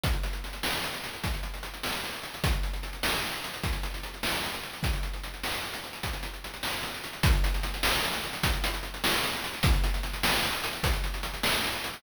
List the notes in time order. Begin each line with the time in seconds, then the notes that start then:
0.04 kick, closed hi-hat
0.13 closed hi-hat
0.23 closed hi-hat
0.33 closed hi-hat
0.44 closed hi-hat
0.53 closed hi-hat
0.63 snare
0.73 closed hi-hat
0.84 closed hi-hat
0.94 closed hi-hat
1.04 closed hi-hat
1.14 closed hi-hat
1.24 kick, closed hi-hat
1.34 closed hi-hat
1.43 closed hi-hat
1.54 closed hi-hat
1.63 closed hi-hat
1.74 closed hi-hat
1.83 snare
1.94 closed hi-hat
2.04 closed hi-hat
2.13 closed hi-hat
2.23 closed hi-hat
2.34 closed hi-hat
2.44 kick, closed hi-hat
2.53 closed hi-hat
2.63 closed hi-hat
2.73 closed hi-hat
2.83 closed hi-hat
2.93 closed hi-hat
3.03 snare
3.13 closed hi-hat
3.24 closed hi-hat
3.33 closed hi-hat
3.44 closed hi-hat
3.54 closed hi-hat
3.64 kick, closed hi-hat
3.73 closed hi-hat
3.83 closed hi-hat
3.94 closed hi-hat
4.03 closed hi-hat
4.14 closed hi-hat
4.23 snare
4.34 closed hi-hat
4.44 closed hi-hat
4.54 closed hi-hat
4.63 closed hi-hat
4.73 closed hi-hat
4.83 kick, closed hi-hat
4.93 closed hi-hat
5.03 closed hi-hat
5.14 closed hi-hat
5.24 closed hi-hat
5.34 closed hi-hat
5.44 snare
5.53 closed hi-hat
5.63 closed hi-hat
5.74 closed hi-hat
5.84 closed hi-hat
5.93 closed hi-hat
6.03 kick, closed hi-hat
6.13 closed hi-hat
6.23 closed hi-hat
6.33 closed hi-hat
6.44 closed hi-hat
6.54 closed hi-hat
6.63 snare
6.74 closed hi-hat
6.83 closed hi-hat
6.94 closed hi-hat
7.04 closed hi-hat
7.13 closed hi-hat
7.23 kick, closed hi-hat
7.33 closed hi-hat
7.44 closed hi-hat
7.54 closed hi-hat
7.63 closed hi-hat
7.74 closed hi-hat
7.83 snare
7.93 closed hi-hat
8.04 closed hi-hat
8.13 closed hi-hat
8.24 closed hi-hat
8.33 closed hi-hat
8.43 kick, closed hi-hat
8.53 closed hi-hat
8.64 closed hi-hat
8.74 closed hi-hat
8.83 closed hi-hat
8.94 closed hi-hat
9.04 snare
9.14 closed hi-hat
9.24 closed hi-hat
9.33 closed hi-hat
9.44 closed hi-hat
9.53 closed hi-hat
9.63 kick, closed hi-hat
9.73 closed hi-hat
9.84 closed hi-hat
9.94 closed hi-hat
10.03 closed hi-hat
10.13 closed hi-hat
10.23 snare
10.34 closed hi-hat
10.43 closed hi-hat
10.53 closed hi-hat
10.64 closed hi-hat
10.73 closed hi-hat
10.83 kick, closed hi-hat
10.93 closed hi-hat
11.04 closed hi-hat
11.14 closed hi-hat
11.23 closed hi-hat
11.34 closed hi-hat
11.43 snare
11.53 closed hi-hat
11.64 closed hi-hat
11.73 closed hi-hat
11.84 closed hi-hat
11.94 closed hi-hat